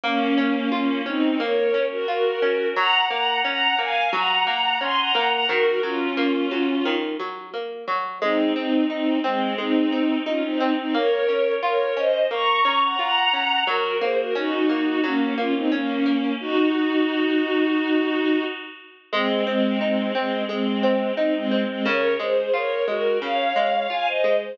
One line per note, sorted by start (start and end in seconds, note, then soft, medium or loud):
0.04 0.34 A#3 loud
0.04 0.69 A#3 medium
0.04 0.69 C#4 medium
0.38 0.68 C#4 medium
0.72 1.01 A#3 medium
0.72 1.01 C#4 medium
0.72 1.02 F4 medium
1.06 1.39 C4 medium
1.06 1.37 C#4 medium
1.06 1.39 D#4 medium
1.40 1.71 A#3 medium
1.40 1.85 A#4 medium
1.40 1.85 C#5 medium
1.74 2.05 C#4 medium
1.91 2.07 F#4 medium
1.91 2.07 A#4 medium
2.08 2.39 F4 medium
2.08 2.67 F#4 medium
2.08 2.67 A#4 medium
2.42 2.73 C#4 medium
2.76 3.07 F#3 loud
2.76 3.05 F#5 medium
2.76 3.05 A#5 medium
3.10 3.41 A#3 medium
3.10 3.38 F#5 medium
3.10 3.38 A#5 medium
3.44 3.75 C#4 medium
3.44 3.78 F#5 medium
3.44 3.78 A#5 medium
3.78 4.09 A#3 medium
3.78 4.09 F5 medium
3.78 4.09 G#5 medium
4.13 4.43 F#3 loud
4.13 4.78 F#5 medium
4.13 4.78 A#5 medium
4.47 4.77 A#3 medium
4.81 5.12 C#4 medium
4.81 4.97 G#5 medium
4.81 4.97 C6 medium
4.98 5.28 F#5 medium
4.98 5.28 A#5 medium
5.15 5.46 A#3 medium
5.32 5.48 F#5 medium
5.32 5.48 A#5 medium
5.49 5.80 D#3 loud
5.49 5.80 F#4 medium
5.49 5.80 A#4 medium
5.83 6.14 F#3 medium
5.83 6.96 C#4 medium
5.83 6.96 F4 medium
6.17 6.48 A#3 medium
6.51 6.82 F#3 medium
6.85 7.16 D#3 loud
7.19 7.50 F#3 medium
7.54 7.84 A#3 medium
7.88 8.18 F#3 medium
8.22 8.52 G#3 loud
8.22 8.53 C4 medium
8.22 8.53 D#4 medium
8.56 8.85 C4 medium
8.56 8.87 C4 medium
8.56 8.85 D#4 medium
8.90 9.19 C4 medium
8.90 9.19 D#4 medium
8.90 9.21 D#4 medium
9.24 9.55 G#3 medium
9.24 9.55 C4 medium
9.58 9.89 G#3 medium
9.58 10.17 C4 medium
9.58 10.17 D#4 medium
9.92 10.23 C4 medium
10.26 10.42 C#4 medium
10.26 10.57 D#4 medium
10.26 10.42 F4 medium
10.43 10.73 C4 medium
10.43 10.73 D#4 medium
10.60 10.91 C4 medium
10.78 10.94 C4 medium
10.78 10.94 D#4 medium
10.94 11.25 A#3 medium
10.94 11.53 A#4 medium
10.94 11.53 C#5 medium
11.29 11.59 C#4 medium
11.62 11.93 F4 medium
11.62 11.94 A#4 medium
11.62 11.94 C#5 medium
11.97 12.27 C#4 medium
11.97 12.25 C5 medium
11.97 12.25 D#5 medium
12.31 12.62 A#3 medium
12.31 12.81 A#5 medium
12.31 12.81 C#6 medium
12.65 12.96 C#4 medium
12.82 12.98 F#5 soft
12.82 12.98 A#5 medium
12.99 13.30 F4 medium
12.99 13.61 F#5 medium
12.99 13.61 A#5 medium
13.33 13.64 C#4 medium
13.67 13.98 F#3 loud
13.67 13.95 F#4 medium
13.67 13.95 A#4 medium
14.01 14.32 A#3 medium
14.01 14.17 G#4 medium
14.01 14.17 C5 medium
14.18 14.35 F#4 medium
14.18 14.35 A#4 medium
14.35 14.66 C#4 medium
14.35 15.00 D#4 medium
14.35 15.00 F#4 medium
14.69 15.00 A#3 medium
15.04 15.34 F#3 loud
15.04 15.34 A#3 medium
15.04 15.34 C#4 medium
15.38 15.68 A#3 medium
15.38 15.54 C#4 medium
15.38 15.54 F4 medium
15.55 15.71 C4 medium
15.55 15.71 D#4 medium
15.72 16.32 A#3 medium
15.72 16.02 C#4 medium
15.72 16.32 C#4 medium
16.06 16.37 A#3 medium
16.40 18.43 D#4 medium
16.40 18.43 F#4 medium
19.12 19.43 G#3 medium
19.12 19.43 G#3 loud
19.12 19.43 C4 medium
19.47 19.79 G#3 medium
19.47 19.77 C4 medium
19.47 19.79 C4 medium
19.81 20.12 G#3 medium
19.81 20.12 C4 medium
19.81 20.12 D#4 medium
20.15 20.43 G#3 medium
20.15 20.43 C4 medium
20.15 20.46 C4 medium
20.49 20.80 G#3 medium
20.49 21.12 G#3 medium
20.49 21.12 C4 medium
20.83 21.14 C4 medium
21.17 21.34 C4 medium
21.17 21.48 D#4 medium
21.17 21.34 D#4 medium
21.34 21.63 G#3 medium
21.34 21.63 C4 medium
21.51 21.82 C4 medium
21.68 21.85 G#3 medium
21.68 21.85 C4 medium
21.85 22.16 C#3 loud
21.85 22.13 A#4 medium
21.85 22.13 C#5 medium
22.19 22.50 G#3 medium
22.19 22.53 G#4 medium
22.19 22.53 C5 medium
22.54 22.84 F4 medium
22.54 22.84 A#4 medium
22.54 22.84 C#5 medium
22.88 23.18 G#3 medium
22.88 23.18 F#4 medium
22.88 23.18 A#4 medium
23.22 23.52 C#3 medium
23.22 23.88 C#5 medium
23.22 23.88 F5 medium
23.56 23.87 G#3 medium
23.90 24.21 F4 medium
23.90 24.06 F5 medium
23.90 24.06 G#5 medium
24.07 24.36 C5 medium
24.07 24.36 D#5 medium
24.24 24.55 G#3 medium
24.41 24.57 G#4 medium
24.41 24.57 C5 medium